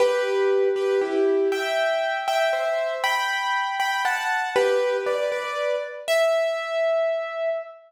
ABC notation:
X:1
M:6/8
L:1/8
Q:3/8=79
K:Em
V:1 name="Acoustic Grand Piano"
[GB]3 [GB] [EG]2 | [eg]3 [eg] [ce]2 | [gb]3 [gb] [fa]2 | [GB]2 [Bd] [Bd]2 z |
e6 |]